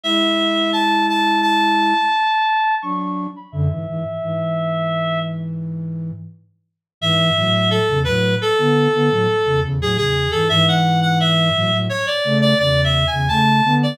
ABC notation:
X:1
M:5/4
L:1/16
Q:1/4=86
K:A
V:1 name="Clarinet"
e4 a2 a2 a8 c' c'2 b | e10 z10 | e4 A2 B2 A8 G G2 A | e f2 f e4 c d2 d (3d2 e2 g2 a3 d |]
V:2 name="Flute"
[G,E]12 z4 [F,D]3 z | [F,,D,] [G,,E,] [G,,E,] z [G,,E,]12 z4 | [G,,E,]2 [A,,F,]3 [E,,C,] [A,,F,]2 z [D,B,]2 [D,B,] [A,,F,] z [E,,C,] [E,,C,] [A,,F,] [E,,C,]2 [G,,E,] | [G,,E,]6 [A,,F,] [A,,F,] z2 [C,A,]2 [E,,C,]3 [E,,C,] [C,A,]2 [D,B,]2 |]